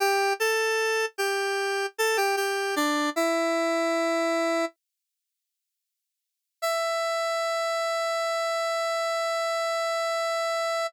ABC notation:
X:1
M:4/4
L:1/16
Q:1/4=76
K:Em
V:1 name="Lead 1 (square)"
[Gg]2 [Aa]4 [Gg]4 [Aa] [Gg] [Gg]2 [Dd]2 | "^rit." [Ee]8 z8 | e16 |]